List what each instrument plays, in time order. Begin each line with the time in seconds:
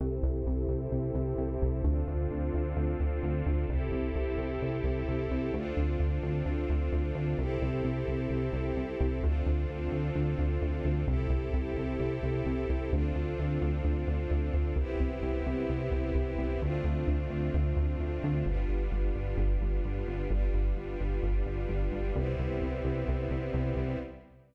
0.00 synth bass 1 C2, string ensemble 1 C4 E4 G4 A4
0.23 synth bass 1 C2
0.47 synth bass 1 C2
0.69 synth bass 1 C2
0.92 synth bass 1 C2
1.15 synth bass 1 C2
1.38 synth bass 1 C2
1.62 synth bass 1 C2
1.84 synth bass 1 D2, string ensemble 1 C4 D4 F4 A4
2.08 synth bass 1 D2
2.31 synth bass 1 D2
2.54 synth bass 1 D2
2.76 synth bass 1 D2
3.00 synth bass 1 D2
3.23 synth bass 1 D2
3.46 synth bass 1 D2
3.69 synth bass 1 C2, string ensemble 1 C4 E4 G4 A4
3.92 synth bass 1 C2
4.16 synth bass 1 C2
4.38 synth bass 1 C2
4.62 synth bass 1 C2
4.84 synth bass 1 C2
5.08 synth bass 1 C2
5.31 synth bass 1 C2
5.54 synth bass 1 D2, string ensemble 1 C4 D4 F4 A4
5.77 synth bass 1 D2
6.00 synth bass 1 D2
6.23 synth bass 1 D2
6.46 synth bass 1 D2
6.70 synth bass 1 D2
6.92 synth bass 1 D2
7.15 synth bass 1 D2
7.38 synth bass 1 C2, string ensemble 1 C4 E4 G4 A4
7.62 synth bass 1 C2
7.84 synth bass 1 C2
8.08 synth bass 1 C2
8.30 synth bass 1 C2
8.53 synth bass 1 C2
8.77 synth bass 1 C2
9.00 synth bass 1 C2
9.23 synth bass 1 D2, string ensemble 1 C4 D4 F4 A4
9.46 synth bass 1 D2
9.69 synth bass 1 D2
9.92 synth bass 1 D2
10.15 synth bass 1 D2
10.39 synth bass 1 D2
10.62 synth bass 1 D2
10.85 synth bass 1 D2
11.07 synth bass 1 C2, string ensemble 1 C4 E4 G4 A4
11.30 synth bass 1 C2
11.54 synth bass 1 C2
11.77 synth bass 1 C2
12.00 synth bass 1 C2
12.23 synth bass 1 C2
12.46 synth bass 1 C2
12.70 synth bass 1 C2
12.92 synth bass 1 D2, string ensemble 1 C4 D4 F4 A4
13.15 synth bass 1 D2
13.39 synth bass 1 D2
13.62 synth bass 1 D2
13.85 synth bass 1 D2
14.08 synth bass 1 D2
14.31 synth bass 1 D2
14.54 synth bass 1 D2
14.76 synth bass 1 C2, string ensemble 1 B3 C4 E4 G4
15.00 synth bass 1 C2
15.22 synth bass 1 C2
15.47 synth bass 1 C2
15.69 synth bass 1 C2
15.92 synth bass 1 C2
16.15 synth bass 1 C2
16.39 synth bass 1 C2
16.62 synth bass 1 D2, string ensemble 1 A3 C4 D4 F4
16.84 synth bass 1 D2
17.08 synth bass 1 D2
17.30 synth bass 1 D2
17.54 synth bass 1 D2
17.77 synth bass 1 D2
18.00 synth bass 1 D2
18.24 synth bass 1 D2
18.46 synth bass 1 G1, string ensemble 1 G3 B3 D4 F4
18.69 synth bass 1 G1
18.92 synth bass 1 G1
19.15 synth bass 1 G1
19.38 synth bass 1 G1
19.61 synth bass 1 G1
19.85 synth bass 1 G1
20.08 synth bass 1 G1
20.30 synth bass 1 G1, string ensemble 1 G3 B3 D4 F4
20.54 synth bass 1 G1
20.76 synth bass 1 G1
21.00 synth bass 1 G1
21.23 synth bass 1 G1
21.46 synth bass 1 G1
21.69 synth bass 1 G1
21.92 synth bass 1 G1
22.16 synth bass 1 C2, string ensemble 1 G3 B3 C4 E4
22.39 synth bass 1 C2
22.62 synth bass 1 C2
22.85 synth bass 1 C2
23.08 synth bass 1 C2
23.31 synth bass 1 C2
23.54 synth bass 1 C2
23.76 synth bass 1 C2